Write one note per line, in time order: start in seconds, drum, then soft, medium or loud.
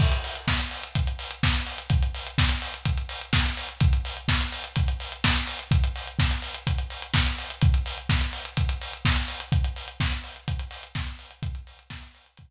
0.00 kick medium
0.00 crash medium
0.12 closed hi-hat medium
0.24 open hi-hat medium
0.35 closed hi-hat medium
0.48 kick medium
0.48 snare loud
0.60 closed hi-hat medium
0.71 open hi-hat medium
0.83 closed hi-hat medium
0.95 kick medium
0.95 closed hi-hat medium
1.07 closed hi-hat medium
1.19 open hi-hat medium
1.31 closed hi-hat medium
1.43 kick medium
1.43 snare loud
1.55 closed hi-hat medium
1.67 open hi-hat medium
1.78 closed hi-hat medium
1.90 kick medium
1.90 closed hi-hat medium
2.03 closed hi-hat medium
2.14 open hi-hat medium
2.27 closed hi-hat medium
2.38 kick medium
2.38 snare loud
2.49 closed hi-hat medium
2.62 open hi-hat medium
2.74 closed hi-hat medium
2.85 kick medium
2.85 closed hi-hat medium
2.98 closed hi-hat medium
3.09 open hi-hat medium
3.21 closed hi-hat medium
3.33 kick medium
3.33 snare loud
3.46 closed hi-hat medium
3.57 open hi-hat medium
3.69 closed hi-hat medium
3.81 kick loud
3.81 closed hi-hat medium
3.93 closed hi-hat medium
4.05 open hi-hat medium
4.17 closed hi-hat medium
4.28 kick medium
4.28 snare loud
4.41 closed hi-hat medium
4.52 open hi-hat medium
4.64 closed hi-hat medium
4.76 kick medium
4.76 closed hi-hat loud
4.88 closed hi-hat medium
5.00 open hi-hat medium
5.12 closed hi-hat medium
5.24 kick medium
5.24 snare loud
5.36 closed hi-hat medium
5.47 open hi-hat medium
5.59 closed hi-hat medium
5.71 kick medium
5.71 closed hi-hat medium
5.84 closed hi-hat medium
5.96 open hi-hat medium
6.07 closed hi-hat medium
6.19 kick medium
6.19 snare medium
6.31 closed hi-hat medium
6.42 open hi-hat medium
6.54 closed hi-hat medium
6.67 kick medium
6.67 closed hi-hat medium
6.78 closed hi-hat medium
6.90 open hi-hat medium
7.02 closed hi-hat medium
7.14 kick medium
7.14 snare loud
7.26 closed hi-hat medium
7.38 open hi-hat medium
7.50 closed hi-hat medium
7.62 kick loud
7.62 closed hi-hat medium
7.74 closed hi-hat medium
7.86 open hi-hat medium
7.98 closed hi-hat medium
8.09 kick medium
8.09 snare medium
8.21 closed hi-hat medium
8.33 open hi-hat medium
8.45 closed hi-hat medium
8.57 kick medium
8.57 closed hi-hat medium
8.69 closed hi-hat medium
8.82 open hi-hat medium
8.93 closed hi-hat medium
9.05 kick medium
9.05 snare loud
9.16 closed hi-hat medium
9.28 open hi-hat medium
9.40 closed hi-hat medium
9.52 kick medium
9.52 closed hi-hat medium
9.64 closed hi-hat medium
9.76 open hi-hat medium
9.88 closed hi-hat medium
10.00 kick medium
10.00 snare medium
10.12 closed hi-hat medium
10.24 open hi-hat medium
10.36 closed hi-hat medium
10.48 kick medium
10.48 closed hi-hat medium
10.59 closed hi-hat medium
10.71 open hi-hat medium
10.83 closed hi-hat medium
10.95 kick medium
10.95 snare medium
11.07 closed hi-hat medium
11.19 open hi-hat medium
11.31 closed hi-hat medium
11.43 kick loud
11.43 closed hi-hat medium
11.55 closed hi-hat medium
11.67 open hi-hat medium
11.79 closed hi-hat medium
11.90 kick medium
11.90 snare loud
12.03 closed hi-hat medium
12.15 open hi-hat medium
12.26 closed hi-hat medium
12.37 kick medium
12.37 closed hi-hat medium